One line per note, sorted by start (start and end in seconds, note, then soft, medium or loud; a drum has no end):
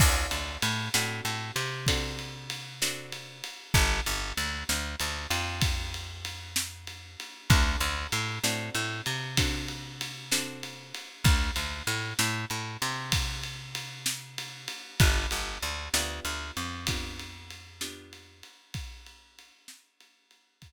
0.00 0.26 D2 loud
0.00 0.85 C4 medium
0.00 0.85 D4 loud
0.00 0.85 F#4 medium
0.00 0.85 A4 medium
0.00 kick loud
0.00 crash loud
0.31 0.58 D2 medium
0.31 ride medium
0.62 0.89 A2 loud
0.62 ride medium
0.94 1.21 A2 loud
0.94 1.78 C4 medium
0.94 1.78 D4 medium
0.94 1.78 F#4 medium
0.94 1.78 A4 medium
0.94 snare loud
1.25 1.51 A2 medium
1.25 ride medium
1.56 3.42 C3 loud
1.56 ride medium
1.87 2.72 C4 medium
1.87 2.72 D4 medium
1.87 2.72 F#4 loud
1.87 2.72 A4 medium
1.87 kick medium
1.87 ride loud
2.19 ride medium
2.50 ride medium
2.82 3.66 C4 medium
2.82 3.66 D4 medium
2.82 3.66 F#4 medium
2.82 3.66 A4 medium
2.82 snare loud
3.12 ride medium
3.44 ride medium
3.74 4.01 G1 loud
3.74 kick loud
3.74 ride medium
4.06 4.33 G1 loud
4.06 ride medium
4.37 4.64 D2 medium
4.37 ride medium
4.69 4.96 D2 medium
4.69 snare loud
4.99 5.27 D2 medium
4.99 ride medium
5.30 7.16 F2 medium
5.30 ride medium
5.61 kick medium
5.61 ride loud
5.94 ride medium
6.25 ride medium
6.56 snare loud
6.87 ride medium
7.20 ride medium
7.50 7.76 D2 loud
7.50 8.34 C4 medium
7.50 8.34 D4 loud
7.50 8.34 F#4 loud
7.50 8.34 A4 medium
7.50 kick loud
7.50 ride medium
7.80 8.07 D2 loud
7.80 ride medium
8.12 8.39 A2 loud
8.12 ride medium
8.43 8.70 A2 medium
8.43 9.28 C4 medium
8.43 9.28 D4 medium
8.43 9.28 F#4 medium
8.43 9.28 A4 medium
8.43 snare loud
8.74 9.01 A2 loud
8.74 ride medium
9.06 10.92 C3 medium
9.06 ride medium
9.37 10.22 C4 medium
9.37 10.22 D4 medium
9.37 10.22 F#4 medium
9.37 10.22 A4 medium
9.37 kick medium
9.37 ride loud
9.68 ride medium
10.01 ride medium
10.31 11.16 C4 medium
10.31 11.16 D4 medium
10.31 11.16 F#4 medium
10.31 11.16 A4 medium
10.31 snare loud
10.63 ride medium
10.94 ride medium
11.24 11.51 D2 loud
11.24 kick loud
11.24 ride medium
11.56 11.83 D2 medium
11.56 ride medium
11.87 12.14 A2 loud
11.87 ride medium
12.19 12.45 A2 loud
12.19 snare loud
12.50 12.77 A2 medium
12.50 ride medium
12.82 14.68 C3 loud
12.82 ride medium
13.12 kick medium
13.12 ride loud
13.43 ride medium
13.75 ride medium
14.06 snare loud
14.38 ride medium
14.68 ride medium
15.00 15.27 G1 loud
15.00 15.84 B3 medium
15.00 15.84 D4 medium
15.00 15.84 F4 loud
15.00 15.84 G4 medium
15.00 kick loud
15.00 ride loud
15.31 15.58 G1 medium
15.31 ride medium
15.62 15.89 D2 medium
15.62 ride medium
15.94 16.20 D2 loud
15.94 16.78 B3 medium
15.94 16.78 D4 medium
15.94 16.78 F4 medium
15.94 16.78 G4 medium
15.94 snare loud
16.25 16.51 D2 loud
16.25 ride medium
16.57 18.43 F2 medium
16.57 ride medium
16.87 17.72 B3 medium
16.87 17.72 D4 medium
16.87 17.72 F4 medium
16.87 17.72 G4 medium
16.87 kick medium
16.87 ride loud
17.19 ride medium
17.50 ride medium
17.81 18.66 B3 medium
17.81 18.66 D4 medium
17.81 18.66 F4 medium
17.81 18.66 G4 medium
17.81 snare loud
18.13 ride medium
18.43 ride medium
18.74 kick medium
18.74 ride loud
19.06 ride medium
19.39 ride medium
19.68 snare loud
20.00 ride medium
20.31 ride medium
20.62 kick medium
20.62 ride medium